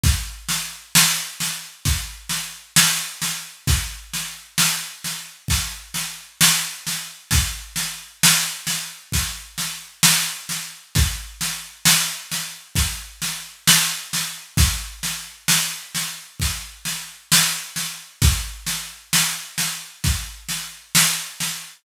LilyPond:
\new DrumStaff \drummode { \time 4/4 \tempo 4 = 66 <bd sn>8 sn8 sn8 sn8 <bd sn>8 sn8 sn8 sn8 | <bd sn>8 sn8 sn8 sn8 <bd sn>8 sn8 sn8 sn8 | <bd sn>8 sn8 sn8 sn8 <bd sn>8 sn8 sn8 sn8 | <bd sn>8 sn8 sn8 sn8 <bd sn>8 sn8 sn8 sn8 |
<bd sn>8 sn8 sn8 sn8 <bd sn>8 sn8 sn8 sn8 | <bd sn>8 sn8 sn8 sn8 <bd sn>8 sn8 sn8 sn8 | }